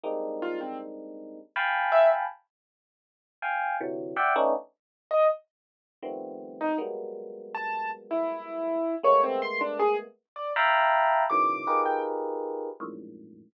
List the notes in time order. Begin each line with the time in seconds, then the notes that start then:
0.03 G3 G#3 A#3 C4 D4 D#4
0.42 F4
0.61 C4
1.56 F5 G5 G#5 A5 B5
1.92 E5
3.42 F5 G5 G#5
3.80 C3 D3 E3 F#3
4.16 D5 E5 F#5 G5
4.36 A3 B3 C#4 D4 D#4
5.11 D#5
6.03 D#3 F3 G3 A3 B3 C4
6.61 D#4
6.78 F#3 G3 G#3 A#3 B3
7.55 A5
8.11 E4
9.03 G#3 A3 A#3 B3 C#5
9.23 C4
9.42 C6
9.61 D4
9.79 G#4
10.36 D5
10.56 E5 F5 G5 A5 A#5 B5
11.30 A#2 B2 C#3 D#3 E3 F#3 D6
11.67 D#4 F4 G4 G#4 A#4 B4
11.85 G5
12.80 F2 F#2 G#2 A2 A#2